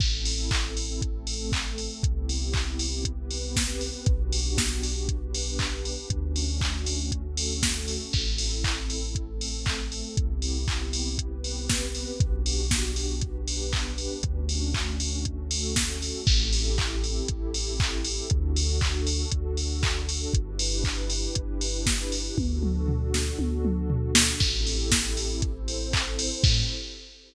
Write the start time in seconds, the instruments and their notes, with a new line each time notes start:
0.00 synth bass 2 A1, pad 2 (warm) C4 E4 A4, kick, crash
0.25 open hi-hat
0.51 kick, clap
0.77 open hi-hat
1.02 pad 2 (warm) A3 C4 A4, kick, closed hi-hat
1.27 open hi-hat
1.52 kick, clap
1.78 open hi-hat
2.03 synth bass 2 C2, pad 2 (warm) B3 C4 E4 G4, kick, closed hi-hat
2.29 open hi-hat
2.53 kick, clap
2.79 open hi-hat
3.05 pad 2 (warm) B3 C4 G4 B4, kick, closed hi-hat
3.31 open hi-hat
3.56 kick, snare
3.81 open hi-hat
4.06 synth bass 2 B1, pad 2 (warm) B3 D4 F#4 G4, kick, closed hi-hat
4.33 open hi-hat
4.58 kick, snare
4.83 open hi-hat
5.08 pad 2 (warm) B3 D4 G4 B4, kick, closed hi-hat
5.34 open hi-hat
5.59 kick, clap
5.85 open hi-hat
6.10 synth bass 2 D2, pad 2 (warm) A3 C#4 D4 F#4, kick, closed hi-hat
6.36 open hi-hat
6.61 kick, clap
6.86 open hi-hat
7.12 pad 2 (warm) A3 C#4 F#4 A4, kick, closed hi-hat
7.37 open hi-hat
7.63 kick, snare
7.88 open hi-hat
8.13 synth bass 2 A1, pad 2 (warm) C4 E4 A4, kick, crash
8.38 open hi-hat
8.64 kick, clap
8.90 open hi-hat
9.15 pad 2 (warm) A3 C4 A4, kick, closed hi-hat
9.41 open hi-hat
9.66 kick, clap
9.92 open hi-hat
10.17 synth bass 2 C2, pad 2 (warm) B3 C4 E4 G4, kick, closed hi-hat
10.42 open hi-hat
10.68 kick, clap
10.93 open hi-hat
11.18 pad 2 (warm) B3 C4 G4 B4, kick, closed hi-hat
11.44 open hi-hat
11.69 kick, snare
11.95 open hi-hat
12.20 synth bass 2 B1, pad 2 (warm) B3 D4 F#4 G4, kick, closed hi-hat
12.46 open hi-hat
12.71 kick, snare
12.96 open hi-hat
13.21 pad 2 (warm) B3 D4 G4 B4, kick, closed hi-hat
13.48 open hi-hat
13.73 kick, clap
13.98 open hi-hat
14.23 synth bass 2 D2, pad 2 (warm) A3 C#4 D4 F#4, kick, closed hi-hat
14.49 open hi-hat
14.74 kick, clap
15.00 open hi-hat
15.25 pad 2 (warm) A3 C#4 F#4 A4, kick, closed hi-hat
15.51 open hi-hat
15.76 kick, snare
16.02 open hi-hat
16.27 synth bass 2 A1, pad 2 (warm) C4 E4 G4 A4, kick, crash
16.53 open hi-hat
16.78 kick, clap
17.04 open hi-hat
17.28 synth bass 2 A1, kick, closed hi-hat
17.54 open hi-hat
17.80 kick, clap
18.05 open hi-hat
18.30 synth bass 2 D2, pad 2 (warm) D4 F#4 A4, kick, closed hi-hat
18.56 open hi-hat
18.81 kick, clap
19.07 open hi-hat
19.31 synth bass 2 D2, kick, closed hi-hat
19.57 open hi-hat
19.83 kick, clap
20.09 open hi-hat
20.33 synth bass 2 G1, pad 2 (warm) D4 E4 G4 B4, kick, closed hi-hat
20.59 open hi-hat
20.84 kick, clap
21.10 open hi-hat
21.35 synth bass 2 G1, kick, closed hi-hat
21.61 open hi-hat
21.86 kick, snare
22.12 open hi-hat
22.37 synth bass 2 D2, pad 2 (warm) D4 F#4 A4, kick, high tom
22.63 mid tom
22.88 floor tom
23.14 snare
23.39 synth bass 2 D2, high tom
23.65 mid tom
23.90 floor tom
24.15 snare
24.40 synth bass 2 A1, pad 2 (warm) C4 E4 G4 A4, kick, crash
24.67 open hi-hat
24.92 kick, snare
25.17 open hi-hat
25.42 pad 2 (warm) C4 E4 A4 C5, kick, closed hi-hat
25.68 open hi-hat
25.93 kick, clap
26.19 open hi-hat
26.44 synth bass 2 A2, pad 2 (warm) C4 E4 G4 A4, kick, crash